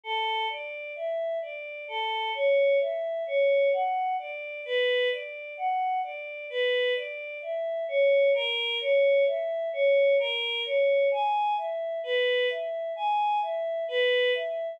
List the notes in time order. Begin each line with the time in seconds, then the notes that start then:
0.03 A4
0.50 D5
0.96 E5
1.42 D5
1.88 A4
2.34 C#5
2.80 E5
3.27 C#5
3.73 F#5
4.19 D5
4.65 B4
5.11 D5
5.57 F#5
6.03 D5
6.50 B4
6.96 D5
7.42 E5
7.88 C#5
8.34 A#4
8.80 C#5
9.27 E5
9.73 C#5
10.19 A#4
10.65 C#5
11.11 G#5
11.57 E5
12.03 B4
12.50 E5
12.96 G#5
13.42 E5
13.88 B4
14.34 E5